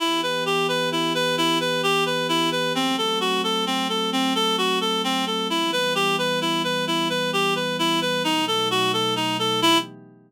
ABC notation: X:1
M:3/4
L:1/8
Q:1/4=131
K:Em
V:1 name="Clarinet"
E B G B E B | E B G B E B | C A F A C A | C A F A C A |
E B G B E B | E B G B E B | ^D A F A D A | E2 z4 |]
V:2 name="Pad 5 (bowed)"
[E,B,G]6- | [E,B,G]6 | [F,A,C]6- | [F,A,C]6 |
[E,G,B,]6- | [E,G,B,]6 | [B,,F,A,^D]6 | [E,B,G]2 z4 |]